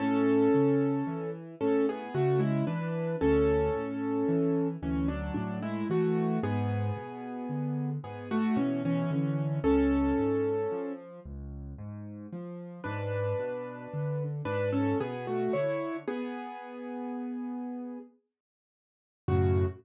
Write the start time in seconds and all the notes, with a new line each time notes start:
0.00 A2 C#4 A4
0.54 C#3
1.07 E3
1.60 A2 C#4 A4
1.89 B3 G#4
2.15 C#3 A3 F#4
2.40 G#3 E4
2.67 E3 D4 B4
3.21 D2 C#4 A4
3.76 A2
4.28 E3
4.83 D2 E3 C#4
5.08 F#3 D4
5.34 A2 F#3 D4
5.63 G#3 E4
5.90 E3 A3 F#4
6.43 G#2 B3 G#4
6.97 B2
7.49 D3
8.04 G#2 B3 G#4
8.31 A3 F#4
8.56 B2 E3 C#4
8.85 E3 C#4
9.11 D3 E3 C#4
9.64 C#2 C#4 A4
10.18 G#2
10.72 F3
11.25 C#2
11.78 G#2
12.33 F3
12.84 G#2 D4 B4
13.39 B2
13.94 D3
14.45 G#2 D4 B4
14.73 C#4 A4
15.00 B2 B3 G#4
15.27 A3 F#4
15.53 D3 E4 C#5
16.08 B3 G#4
19.28 F#2 A2 C#3 F#4